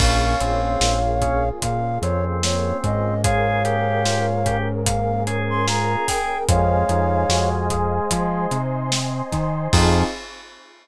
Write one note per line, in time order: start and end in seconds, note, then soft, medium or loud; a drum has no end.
0.00 0.35 A#1 loud
0.00 0.37 A#3 medium
0.00 3.22 A#3 medium
0.00 0.40 C#4 medium
0.00 3.22 C#4 medium
0.00 3.22 F4 medium
0.00 3.22 G#4 medium
0.00 1.49 C#5 medium
0.00 1.49 F5 medium
0.00 kick loud
0.00 crash loud
0.41 0.77 A#1 medium
0.41 0.98 C4 medium
0.41 0.78 C#4 medium
0.41 closed hi-hat medium
0.80 1.51 A#1 loud
0.80 1.18 F4 medium
0.80 snare loud
1.21 1.44 C#4 medium
1.21 1.59 G#4 medium
1.21 kick medium
1.21 closed hi-hat medium
1.62 1.98 A#2 medium
1.62 2.00 F4 medium
1.62 1.99 F5 medium
1.62 kick medium
1.62 closed hi-hat medium
2.02 2.73 F2 medium
2.02 2.40 C4 medium
2.02 3.14 C4 medium
2.02 2.24 C#5 medium
2.02 closed hi-hat medium
2.43 2.81 A#3 medium
2.43 2.78 C#5 medium
2.43 snare loud
2.84 5.96 G#2 loud
2.84 3.21 C#4 medium
2.84 3.22 D#5 medium
2.84 kick medium
2.84 closed hi-hat medium
3.24 6.47 A#3 medium
3.24 6.47 C#4 medium
3.24 3.61 F4 medium
3.24 3.63 G#4 medium
3.24 6.47 G#4 medium
3.24 6.47 A#4 medium
3.24 4.57 C#5 medium
3.24 4.57 F5 medium
3.24 kick loud
3.24 closed hi-hat medium
3.65 4.26 G4 medium
3.65 4.02 G#4 medium
3.65 closed hi-hat medium
4.05 4.42 F4 medium
4.05 snare medium
4.45 4.83 C#4 medium
4.45 4.68 G4 medium
4.45 kick medium
4.45 closed hi-hat medium
4.85 5.23 A#3 medium
4.85 5.23 F5 medium
4.85 kick medium
4.85 closed hi-hat loud
5.27 5.64 C#4 medium
5.27 6.37 G#4 medium
5.27 closed hi-hat medium
5.50 5.66 C6 medium
5.67 6.04 F4 medium
5.67 6.07 A#5 medium
5.67 snare medium
6.07 6.45 G#4 medium
6.07 6.44 G5 medium
6.07 kick medium
6.07 snare soft
6.07 open hi-hat medium
6.48 6.84 F2 loud
6.48 8.57 G#3 medium
6.48 6.85 C4 medium
6.48 8.10 C5 medium
6.48 7.49 C#5 medium
6.48 8.10 D#5 medium
6.48 7.49 F5 medium
6.48 8.10 F5 medium
6.48 8.10 G#5 medium
6.48 kick loud
6.48 closed hi-hat loud
6.89 7.25 F2 loud
6.89 7.26 D#4 medium
6.89 closed hi-hat medium
7.29 8.00 F2 medium
7.29 7.67 F#4 medium
7.29 snare loud
7.70 8.08 G#4 medium
7.70 kick medium
7.70 closed hi-hat medium
8.11 8.47 F3 medium
8.11 8.48 F4 medium
8.11 9.72 C5 medium
8.11 9.72 D#5 medium
8.11 9.72 G#5 medium
8.11 9.72 C6 medium
8.11 kick medium
8.11 closed hi-hat loud
8.51 9.22 C3 medium
8.51 8.89 D#4 medium
8.51 closed hi-hat medium
8.92 9.29 C4 medium
8.92 snare loud
9.32 9.68 D#3 medium
9.32 9.69 D#4 medium
9.32 kick medium
9.32 snare soft
9.32 closed hi-hat medium
9.72 10.03 F2 loud
9.72 10.03 F3 loud
9.72 10.03 C4 loud
9.72 10.04 C4 loud
9.72 10.03 D#4 loud
9.72 10.04 D#4 loud
9.72 10.03 F4 loud
9.72 10.04 F4 medium
9.72 10.03 G#4 medium
9.72 10.04 G#4 loud
9.72 10.02 F5 loud
9.72 kick loud
9.72 crash loud